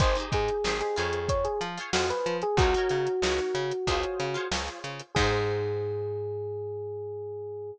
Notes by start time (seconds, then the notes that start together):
0.00 G#1 D#4 G4 G#4 C5, kick, closed hi-hat
0.15 D#4 G4 G#4, closed hi-hat
0.20 C5
0.32 G#2 G#4, kick, closed hi-hat
0.48 closed hi-hat
0.64 G#1 D#4 G4 G#4 C5, snare
0.81 G#4, closed hi-hat
0.96 F2 F4 G#4 C5 C#5, closed hi-hat
1.13 closed hi-hat
1.29 C#5, kick, closed hi-hat
1.45 G#4, closed hi-hat
1.61 F3, closed hi-hat
1.78 F4 G#4 C5 C#5, closed hi-hat
1.93 F2 F4 F#4 G#4 C5 C#5, snare
2.09 B4, snare, closed hi-hat
2.26 F3, closed hi-hat
2.42 G#4, closed hi-hat
2.57 C#2 D#4 F#4 A#4, kick, closed hi-hat
2.62 C#5
2.74 D#4 F#4 A#4 C#5, closed hi-hat
2.89 C#3, closed hi-hat
3.07 closed hi-hat
3.22 C#2 D#4 F#4 A#4, snare
3.26 C#5
3.38 snare, closed hi-hat
3.55 C#3, closed hi-hat
3.72 closed hi-hat
3.87 C#2 F4 G#4 C5 C#5, kick, closed hi-hat
4.03 closed hi-hat
4.20 C#3, closed hi-hat
4.34 F4 G#4 C5 C#5, closed hi-hat
4.51 C#2 F4 G#4 C5 C#5, snare
4.68 closed hi-hat
4.84 C#3, closed hi-hat
4.99 closed hi-hat
5.15 G#2 D#4 G4 G#4, kick, crash
5.19 C5